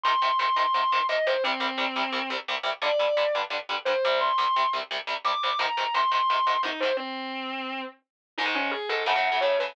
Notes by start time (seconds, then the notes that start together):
0.03 G#2 C3 D#3 C6
0.22 G#2 C3 D#3
0.39 G#2 C3 D#3 C6
0.56 G#2 C3 D#3 C6
0.74 G#2 C3 D#3
0.92 G#2 C3 D#3
1.09 G#2 C3 D#3 D#5
1.27 G#2 C3 D#3 C5
1.44 C2 C3 G3 C4
1.60 C2 C3 G3
1.78 C2 C3 G3
1.96 C2 C3 G3
2.12 C2 C3 G3
2.30 C2 C3 G3
2.48 C2 C3 G3
2.63 C2 C3 G3
2.82 G2 D3 G3 D5
2.99 G2 D3 G3
3.17 G2 D3 G3
3.35 G2 D3 G3
3.50 G2 D3 G3
3.69 G2 D3 G3
3.85 G2 D3 G3 C5
4.05 C2 C3 G3
4.21 C6
4.38 C2 C3 G3
4.56 C2 C3 G3
4.73 C2 C3 G3
4.91 C2 C3 G3
5.07 C2 C3 G3
5.24 C2 C3 G3 D6
5.43 C2 C3 G3
5.59 G#2 C3 D#3 A#5
5.77 G#2 C3 D#3
5.94 G#2 C3 D#3 C6
6.11 G#2 C3 D#3 C6
6.30 G#2 C3 D#3
6.47 G#2 C3 D#3
6.63 G#2 C3 D#3 D#4
6.80 G#2 C3 D#3 C5
6.97 C4
8.38 G#2 D#3 G#3 D#4
8.46 G#2 D#3 G#3
8.55 C#4
8.71 G#4
8.89 G#2 D#3 G#3 A4
9.06 F#2 C#3 A3 F#5
9.15 F#2 C#3 A3
9.32 F#2 C#3 A3
9.41 F#2 C#3 A3 C#5
9.59 F#2 C#3 A3 B4